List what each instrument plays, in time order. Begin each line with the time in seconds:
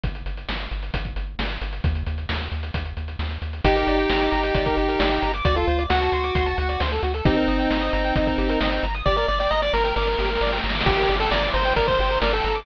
0.04 synth bass 1 G1, kick, closed hi-hat
0.15 closed hi-hat
0.26 synth bass 1 G1, closed hi-hat
0.37 closed hi-hat
0.49 synth bass 1 G1, snare
0.60 closed hi-hat
0.71 synth bass 1 G1, closed hi-hat
0.83 closed hi-hat
0.94 synth bass 1 G1, kick, closed hi-hat
1.05 kick, closed hi-hat
1.16 synth bass 1 G1, closed hi-hat
1.39 synth bass 1 G1, snare, closed hi-hat
1.50 closed hi-hat
1.61 synth bass 1 G1, closed hi-hat
1.73 closed hi-hat
1.84 synth bass 1 D#2, kick, closed hi-hat
1.95 closed hi-hat
2.06 synth bass 1 D#2, closed hi-hat
2.18 closed hi-hat
2.29 synth bass 1 D#2, snare
2.41 closed hi-hat
2.52 synth bass 1 D#2, closed hi-hat
2.63 closed hi-hat
2.74 synth bass 1 D#2, kick, closed hi-hat
2.86 closed hi-hat
2.97 synth bass 1 D#2, closed hi-hat
3.08 closed hi-hat
3.19 synth bass 1 D#2, snare
3.31 closed hi-hat
3.42 synth bass 1 D#2, closed hi-hat
3.53 closed hi-hat
3.64 synth bass 1 G1, lead 1 (square) D#4 G4, kick, closed hi-hat
3.76 lead 1 (square) A#4, closed hi-hat
3.87 synth bass 1 G1, lead 1 (square) D5, closed hi-hat
3.98 lead 1 (square) G5, closed hi-hat
4.10 synth bass 1 G1, lead 1 (square) A#5, snare
4.21 lead 1 (square) D6, closed hi-hat
4.31 synth bass 1 G1, lead 1 (square) A#5, closed hi-hat
4.43 lead 1 (square) G5, closed hi-hat
4.55 synth bass 1 G1, lead 1 (square) D5, kick, closed hi-hat
4.66 lead 1 (square) A#4, kick, closed hi-hat
4.77 synth bass 1 G1, lead 1 (square) G4, closed hi-hat
4.88 lead 1 (square) A#4, closed hi-hat
4.99 synth bass 1 G1, lead 1 (square) D5, snare
5.11 lead 1 (square) G5, closed hi-hat
5.22 synth bass 1 G1, lead 1 (square) A#5, closed hi-hat
5.34 lead 1 (square) D6, closed hi-hat
5.45 synth bass 1 D2, lead 1 (square) F#4 D5, kick, closed hi-hat
5.56 lead 1 (square) F4 A4, closed hi-hat
5.67 synth bass 1 D2, lead 1 (square) C5, closed hi-hat
5.79 lead 1 (square) D5, closed hi-hat
5.90 synth bass 1 D2, lead 1 (square) F#4 F#5, snare
6.01 lead 1 (square) A5, closed hi-hat
6.12 synth bass 1 D2, lead 1 (square) C6, closed hi-hat
6.24 lead 1 (square) D6, closed hi-hat
6.35 synth bass 1 D2, lead 1 (square) C6, kick, closed hi-hat
6.46 lead 1 (square) A5, closed hi-hat
6.58 synth bass 1 D2, lead 1 (square) F#5, closed hi-hat
6.69 lead 1 (square) D5, closed hi-hat
6.80 synth bass 1 D2, lead 1 (square) C5, snare
6.92 lead 1 (square) A4, closed hi-hat
7.03 synth bass 1 D2, lead 1 (square) F#4, closed hi-hat
7.14 lead 1 (square) A4, closed hi-hat
7.25 synth bass 1 G1, lead 1 (square) C4 D#4 G4, kick, closed hi-hat
7.37 lead 1 (square) A#4
7.47 synth bass 1 G1, lead 1 (square) D#5, closed hi-hat
7.59 lead 1 (square) G5, closed hi-hat
7.70 synth bass 1 G1, lead 1 (square) A#5, snare
7.81 lead 1 (square) D#6, closed hi-hat
7.93 synth bass 1 G1, lead 1 (square) A#5, closed hi-hat
8.04 lead 1 (square) G5, closed hi-hat
8.16 synth bass 1 G1, lead 1 (square) D#5, kick, closed hi-hat
8.27 lead 1 (square) A#4, kick, closed hi-hat
8.38 synth bass 1 G1, lead 1 (square) G4, closed hi-hat
8.49 lead 1 (square) A#4, closed hi-hat
8.60 synth bass 1 G1, lead 1 (square) D#5, snare
8.72 lead 1 (square) G5, closed hi-hat
8.83 synth bass 1 G1, lead 1 (square) A#5, closed hi-hat
8.94 lead 1 (square) D#6, closed hi-hat
9.06 synth bass 1 G1, lead 1 (square) G4 D5, kick, snare
9.16 lead 1 (square) A#4 D5, snare
9.28 synth bass 1 G1, lead 1 (square) D5, snare
9.40 lead 1 (square) D5 G5, snare
9.51 synth bass 1 G1, lead 1 (square) D#5 A#5, snare
9.62 lead 1 (square) D5 D6, snare
9.73 synth bass 1 G1, lead 1 (square) A#4 A#5, snare
9.84 lead 1 (square) A#4 G5, snare
9.96 synth bass 1 G1, lead 1 (square) A#4 D5, snare
10.02 snare
10.07 lead 1 (square) A#4, snare
10.13 snare
10.19 synth bass 1 G1, lead 1 (square) G4, snare
10.24 snare
10.30 lead 1 (square) A#4, snare
10.35 snare
10.41 synth bass 1 G1, lead 1 (square) D5, snare
10.47 snare
10.52 lead 1 (square) G5, snare
10.58 snare
10.64 synth bass 1 G1, lead 1 (square) A#5, snare
10.69 snare
10.75 lead 1 (square) D6, snare
10.81 snare
10.86 synth bass 1 G1, lead 1 (square) G4, kick, crash
10.97 lead 1 (square) A#4, closed hi-hat
11.09 synth bass 1 G1, lead 1 (square) D5, closed hi-hat
11.20 lead 1 (square) A4 G5, closed hi-hat
11.31 synth bass 1 G1, lead 1 (square) D5 A#5, snare
11.43 lead 1 (square) D6, closed hi-hat
11.54 synth bass 1 G1, lead 1 (square) C5 A#5, closed hi-hat
11.65 lead 1 (square) G5, closed hi-hat
11.76 synth bass 1 G1, lead 1 (square) A#4 D5, kick, closed hi-hat
11.87 lead 1 (square) A#4 C5, kick, closed hi-hat
11.99 synth bass 1 G1, lead 1 (square) G4, closed hi-hat
12.10 lead 1 (square) A#4, closed hi-hat
12.22 synth bass 1 G1, lead 1 (square) A#4 D5, snare
12.33 lead 1 (square) A4 G5, closed hi-hat
12.44 synth bass 1 G1, lead 1 (square) A#5, closed hi-hat
12.55 lead 1 (square) D6, closed hi-hat